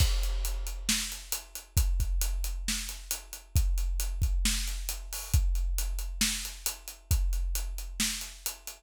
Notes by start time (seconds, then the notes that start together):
0.00 kick, crash
0.23 closed hi-hat
0.45 closed hi-hat
0.67 closed hi-hat
0.89 snare
1.12 closed hi-hat
1.32 closed hi-hat
1.55 closed hi-hat
1.77 kick, closed hi-hat
2.00 kick, closed hi-hat
2.21 closed hi-hat
2.44 closed hi-hat
2.68 snare
2.89 closed hi-hat
3.11 closed hi-hat
3.33 closed hi-hat
3.56 kick, closed hi-hat
3.78 closed hi-hat
4.00 closed hi-hat
4.22 kick, closed hi-hat
4.45 snare
4.67 closed hi-hat
4.89 closed hi-hat
5.13 open hi-hat
5.34 kick, closed hi-hat
5.55 closed hi-hat
5.78 closed hi-hat
5.99 closed hi-hat
6.21 snare
6.45 closed hi-hat
6.66 closed hi-hat
6.88 closed hi-hat
7.11 kick, closed hi-hat
7.33 closed hi-hat
7.55 closed hi-hat
7.78 closed hi-hat
8.00 snare
8.21 closed hi-hat
8.46 closed hi-hat
8.67 closed hi-hat